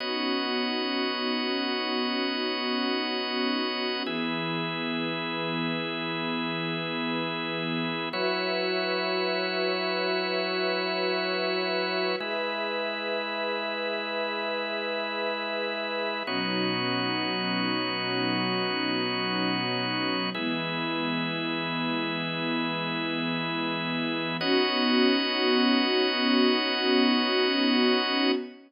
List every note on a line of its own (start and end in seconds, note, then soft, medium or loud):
0.00 4.03 B3 medium
0.00 4.03 C#4 medium
0.00 4.03 D#4 medium
0.00 4.03 F#4 medium
0.00 4.03 C#5 medium
0.00 4.03 D#5 medium
4.05 8.08 E3 medium
4.05 8.08 B3 medium
4.05 8.09 E4 medium
4.05 8.08 G#4 medium
4.05 8.09 G#4 medium
4.05 8.09 B4 medium
8.13 12.16 F#3 medium
8.13 12.16 E4 medium
8.13 12.16 F#4 medium
8.13 12.16 B4 medium
8.13 12.16 C#5 medium
8.13 12.16 E5 medium
12.20 16.23 G#3 medium
12.20 16.23 E4 medium
12.20 16.24 G#4 medium
12.20 16.23 B4 medium
12.20 16.24 B4 medium
12.20 16.24 E5 medium
16.26 20.29 B2 medium
16.26 20.29 F#3 medium
16.26 20.30 B3 medium
16.26 20.29 C#4 medium
16.26 20.29 D#4 medium
16.26 20.30 D#4 medium
16.26 20.30 F#4 medium
16.26 20.30 C#5 medium
20.35 24.38 E3 medium
20.35 24.38 G#3 medium
20.35 24.38 B3 medium
20.35 24.37 E4 loud
20.35 24.37 G#4 medium
20.35 24.37 B4 medium
24.40 28.31 B3 loud
24.40 28.32 B3 medium
24.40 28.31 C#4 loud
24.40 28.31 D#4 medium
24.40 28.31 F#4 loud
24.40 28.32 F#4 loud
24.40 28.32 C#5 loud
24.40 28.32 D#5 loud